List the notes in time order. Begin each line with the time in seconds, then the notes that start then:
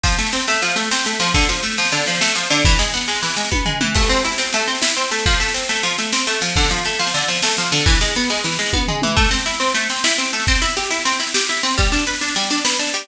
0.03 F3, kick, snare
0.12 snare
0.18 A3, snare
0.26 snare
0.32 C4, snare
0.40 snare
0.47 A3, snare
0.54 snare
0.62 F3, snare
0.69 snare
0.76 A3, snare
0.84 snare
0.91 C4, snare
0.99 snare
1.05 A3, snare
1.13 snare
1.20 F3, snare
1.27 snare
1.34 D3, kick, snare
1.41 snare
1.49 F3, snare
1.56 snare
1.63 A3, snare
1.71 snare
1.77 F3, snare
1.85 snare
1.92 D3, snare
2.00 snare
2.06 F3, snare
2.15 snare
2.21 A3, snare
2.28 snare
2.35 F3, snare
2.43 snare
2.50 D3, snare
2.58 snare
2.65 E3, kick, snare
2.72 snare
2.79 G#3, snare
2.87 snare
2.94 B3, snare
3.01 snare
3.08 G#3, snare
3.15 snare
3.23 E3, snare
3.30 snare
3.36 G#3, snare
3.45 snare
3.52 B3, kick, high tom
3.66 G#3, floor tom
3.81 E3, mid tom
3.95 A3, kick, snare, crash
4.03 snare
4.09 C4, snare
4.16 snare
4.25 E4, snare
4.32 snare
4.38 C4, snare
4.46 snare
4.53 A3, snare
4.60 snare
4.68 C4, snare
4.75 snare
4.82 E4, snare
4.89 snare
4.96 C4, snare
5.04 snare
5.11 A3, snare
5.19 snare
5.26 F3, kick, snare
5.32 snare
5.40 A3, snare
5.48 snare
5.54 C4, snare
5.62 snare
5.69 A3, snare
5.75 snare
5.83 F3, snare
5.91 snare
5.98 A3, snare
6.05 snare
6.12 C4, snare
6.19 snare
6.27 A3, snare
6.35 snare
6.41 F3, snare
6.49 snare
6.56 D3, kick, snare
6.63 snare
6.70 F3, snare
6.78 snare
6.85 A3, snare
6.93 snare
6.99 F3, snare
7.07 snare
7.14 D3, snare
7.21 snare
7.28 F3, snare
7.35 snare
7.42 A3, snare
7.50 snare
7.57 F3, snare
7.65 snare
7.72 D3, snare
7.80 snare
7.86 E3, kick, snare
7.95 snare
8.01 G#3, snare
8.08 snare
8.15 B3, snare
8.24 snare
8.30 G#3, snare
8.38 snare
8.44 E3, snare
8.52 snare
8.59 G#3, snare
8.66 snare
8.73 B3, kick, high tom
8.88 G#3, floor tom
9.02 E3, mid tom
9.16 A3, kick, snare
9.24 snare
9.31 C4, snare
9.39 snare
9.46 E4, snare
9.53 snare
9.60 C4, snare
9.68 snare
9.74 A3, snare
9.82 snare
9.89 C4, snare
9.97 snare
10.04 E4, snare
10.11 snare
10.18 C4, snare
10.25 snare
10.33 A3, snare
10.40 snare
10.47 C4, kick, snare
10.55 snare
10.62 E4, snare
10.69 snare
10.77 G4, snare
10.83 snare
10.90 E4, snare
10.99 snare
11.05 C4, snare
11.12 snare
11.20 E4, snare
11.27 snare
11.34 G4, snare
11.41 snare
11.49 E4, snare
11.57 snare
11.63 C4, snare
11.71 snare
11.78 G3, kick, snare
11.84 snare
11.92 D4, snare
11.99 snare
12.06 B4, snare
12.13 snare
12.21 D4, snare
12.28 snare
12.35 G3, snare
12.43 snare
12.50 D4, snare
12.58 snare
12.65 B4, snare
12.72 snare
12.79 D4, snare
12.87 snare
12.94 G3, snare
13.02 snare